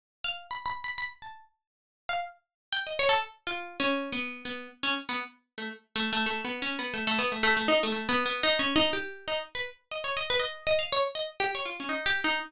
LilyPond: \new Staff { \time 5/4 \tempo 4 = 121 r8 f''8 \tuplet 3/2 { b''8 b''8 b''8 } b''16 r16 a''8 r4 r16 f''16 r8 | r8 g''16 ees''16 des''16 a'16 r8 \tuplet 3/2 { f'4 des'4 b4 } b8 r16 des'16 | r16 b16 r8. a16 r8 \tuplet 3/2 { a8 a8 a8 b8 des'8 b8 } a16 a16 b16 a16 | a16 a16 ees'16 a16 \tuplet 3/2 { a8 b8 b8 ees'8 des'8 ees'8 } g'8. ees'16 r16 b'16 r8 |
ees''16 des''16 ees''16 b'16 ees''8 ees''16 f''16 des''16 r16 ees''16 r16 g'16 des''16 f'16 des'16 \tuplet 3/2 { ees'8 g'8 ees'8 } | }